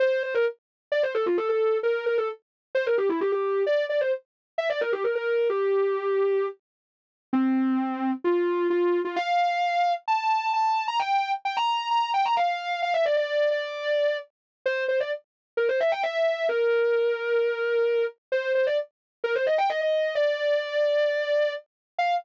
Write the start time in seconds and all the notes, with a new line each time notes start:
0.00 C5
0.23 C5
0.34 A#4
0.92 D5
1.03 C5
1.14 A4
1.26 F4
1.37 A4
1.49 A4
1.83 A#4
2.06 A#4
2.18 A4
2.75 C5
2.86 A#4
2.98 G4
3.09 E4
3.21 G4
3.32 G4
3.67 D5
3.89 D5
4.01 C5
4.58 E5
4.70 D5
4.81 A#4
4.92 G4
5.04 A#4
5.15 A#4
5.50 G4
7.33 C4
8.24 F4
8.70 F4
9.05 F4
9.16 F5
10.08 A5
10.53 A5
10.88 A#5
10.99 G5
11.45 G5
11.57 A#5
11.68 A#5
11.91 A#5
12.14 G5
12.25 A#5
12.37 F5
12.82 F5
12.94 E5
13.05 D5
13.17 D5
13.51 D5
14.66 C5
14.88 C5
15.00 D5
15.57 A#4
15.69 C5
15.80 E5
15.92 G5
16.03 E5
16.15 E5
16.49 A#4
18.32 C5
18.55 C5
18.67 D5
19.24 A#4
19.35 C5
19.46 D#5
19.58 G5
19.69 D#5
19.81 D#5
20.15 D5
21.98 F5